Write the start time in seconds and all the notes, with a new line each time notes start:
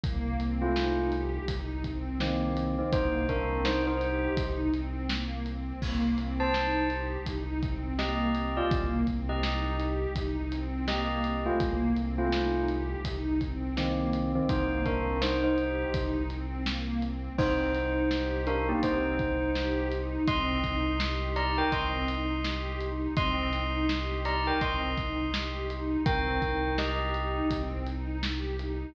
0.04 C2 A#3, kick, closed hi-hat
0.40 C4, closed hi-hat
0.62 A3 F4
0.76 D#4, snare
1.12 G4, closed hi-hat
1.48 C2 D#4, kick, closed hi-hat
1.84 C4, kick, closed hi-hat
2.20 D#3 A#3 C4, snare
2.57 C4, closed hi-hat
2.79 D#3 C4
2.92 C2 A#3 D#4 C5, kick, closed hi-hat
3.29 C4 D4 A#4, kick, closed hi-hat
3.65 D#4 C5, snare
3.87 D#4 C5
4.00 G4, closed hi-hat
4.37 C2 D#4, kick, closed hi-hat
4.73 C4, closed hi-hat
5.09 A#3, snare
5.46 C4, closed hi-hat
5.82 C2 A#3, kick, crash
6.18 C4, closed hi-hat
6.40 C5 A5
6.54 D#4, snare
6.90 G4, closed hi-hat
7.26 C2 D#4, kick, closed hi-hat
7.62 C4, kick, closed hi-hat
7.99 A#3 G4 D#5, snare
8.35 C4, closed hi-hat
8.57 F4 D5
8.71 C2 A#3, kick, closed hi-hat
9.07 C4, kick, closed hi-hat
9.29 G4 D#5
9.43 D#4, snare
9.80 G4, closed hi-hat
10.15 C2 D#4, kick, closed hi-hat
10.52 C4, closed hi-hat
10.88 A#3 G4 D#5, snare
11.24 C4, closed hi-hat
11.46 A3 F4
11.60 C2 A#3, kick, closed hi-hat
11.97 C4, closed hi-hat
12.18 A3 F4
12.32 D#4, snare
12.69 G4, closed hi-hat
13.05 C2 D#4, kick, closed hi-hat
13.41 C4, kick, closed hi-hat
13.77 D#3 A#3 C4, snare
14.13 C4, closed hi-hat
14.35 D#3 C4
14.49 C2 A#3 D#4 C5, kick, closed hi-hat
14.86 C4 D4 A#4, kick, closed hi-hat
15.22 D#4 C5, snare
15.44 D#4 C5
15.58 G4, closed hi-hat
15.94 C2 D#4, kick, closed hi-hat
16.29 C4, closed hi-hat
16.66 A#3, snare
17.02 C4, closed hi-hat
17.38 C2 C4 D#4 C5, kick, crash
17.74 D#4, snare, closed hi-hat
18.11 G4, snare
18.47 D4 D#4 A#4, closed hi-hat
18.69 A#3 G4
18.83 C2 C4 D#4 C5, kick, closed hi-hat
19.19 D#4, kick, closed hi-hat
19.55 G4, snare
19.92 D#4, closed hi-hat
20.28 C2 C4 D#5 C6, kick, closed hi-hat
20.64 D#4, kick, closed hi-hat
21.00 G4, snare
21.36 D#4 D5 A#5, closed hi-hat
21.58 A#4 G5
21.72 C2 C4 D#5 C6, kick, closed hi-hat
22.08 D#4, closed hi-hat
22.44 G4, snare
22.81 D#4, closed hi-hat
23.16 C2 C4 D#5 C6, kick, closed hi-hat
23.53 D#4, closed hi-hat
23.89 G4, snare
24.25 D#4 D5 A#5, closed hi-hat
24.47 A#4 G5
24.61 C2 C4 D#5 C6, kick, closed hi-hat
24.98 D#4, kick, closed hi-hat
25.33 G4, snare
25.69 D#4, closed hi-hat
26.06 C2 C4 A#4 G5, kick, closed hi-hat
26.42 D#4, kick, closed hi-hat
26.78 G4 D#5, snare
27.14 D#4, closed hi-hat
27.50 C2 C4, kick, closed hi-hat
27.86 D#4, closed hi-hat
28.23 G4, snare
28.59 D#4, closed hi-hat